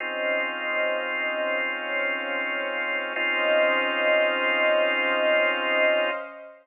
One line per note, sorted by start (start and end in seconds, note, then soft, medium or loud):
0.00 3.13 C#3 medium
0.00 3.13 C4 loud
0.00 1.56 C#4 medium
0.00 3.13 D#4 medium
0.00 3.13 F4 medium
0.00 1.56 C5 medium
0.00 1.56 D#5 medium
0.00 1.56 F5 medium
1.59 3.15 C#4 medium
1.59 3.15 C5 medium
1.59 3.15 C#5 medium
1.59 3.15 F5 medium
3.16 6.10 C#3 medium
3.16 6.10 C4 loud
3.16 6.10 C#4 loud
3.16 6.10 D#4 loud
3.16 6.10 F4 loud
3.16 6.10 C5 loud
3.16 6.10 D#5 loud
3.16 6.10 F5 loud